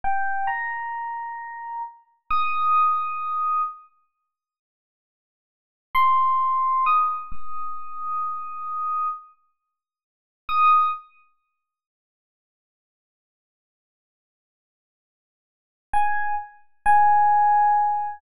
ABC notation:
X:1
M:4/4
L:1/8
Q:1/4=132
K:Ebmix
V:1 name="Electric Piano 1"
g2 b6 | z2 e'6 | z8 | z2 c'4 e'2 |
e'8 | z6 e'2 | [K:F#mix] z8 | z8 |
z6 g2 | z2 g6 |]